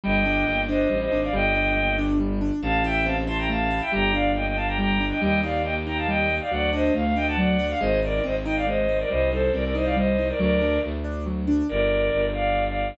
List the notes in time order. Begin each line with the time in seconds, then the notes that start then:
0.04 G1 G3 D#5 G5
0.25 D4
0.46 G1 A#3
0.68 D4 C5 D#5
0.89 A1 G3
1.01 C5 D#5
1.11 G#1 D4
1.23 D5 F5
1.32 G1 G3 D#5 G5
1.55 D4
1.76 A#3
1.98 D4
2.20 G3
2.41 D4
2.62 A1 A3 F5 A5
2.84 E4 E5 G5
3.05 C4 F5 A5
3.27 E4 A5 C6
3.38 G5 A#5
3.49 A3 F5 A5
3.70 E4
3.81 E5 G5
3.92 G1 G3 G5 A#5
4.13 D4 D5 F5
4.35 A#3 D#5 G5
4.46 D#5 G5
4.56 D4 F5 A5
4.67 G5 A#5
4.78 G3 G5 A#5
5.00 D4
5.11 D#5 G5
5.21 D#2 G3 D#5 G5
5.43 D#4 D5 F5
5.64 A#3 D#5 G5
5.86 D#4 G5 A#5
5.97 F5 A5
6.07 G3 D#5 G5
6.30 D#4
6.41 D5 F5
6.51 D2 F#3 D5 F#5
6.73 D4 C5 D#5
6.94 D2 A3 F5
7.05 F5
7.16 D4 D#5 G5
7.27 F#5 A5
7.37 F#3 D5 F#5
7.59 D4
7.70 F5
7.80 G#1 G#3 C5 D#5
8.02 D#4 A#4 D5
8.24 G#1 C4 C5 D#5
8.45 D#4 D#5 G5
8.56 D5 F5
8.67 G#3 C5 D#5
8.88 D#4
8.99 A#4 D5
9.09 C2 G3 C5 D#5
9.31 D#4 A4 C5
9.53 C2 C4 A#4 D5
9.64 A#4 D5
9.75 D#4 C5 D#5
9.85 D5 F5
9.96 G3 C5 D#5
10.18 D#4
10.29 A#4 D5
10.39 D2 F#3 A#4 D5
10.61 D4
10.83 D2 A3
11.04 D4
11.26 F#3
11.47 D4
11.69 G1 A#4 D5
12.13 G1
12.33 D5 F5
12.67 D5 F5